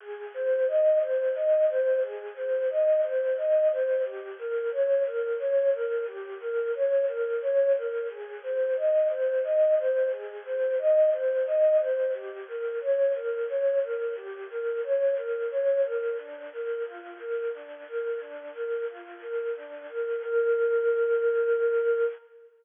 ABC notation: X:1
M:3/4
L:1/8
Q:1/4=89
K:Ab
V:1 name="Ocarina"
A c e c e c | A c e c e c | G B d B d B | G B d B d B |
A c e c e c | A c e c e c | G B d B d B | G B d B d B |
[K:Bb] D B F B D B | D B F B D B | B6 |]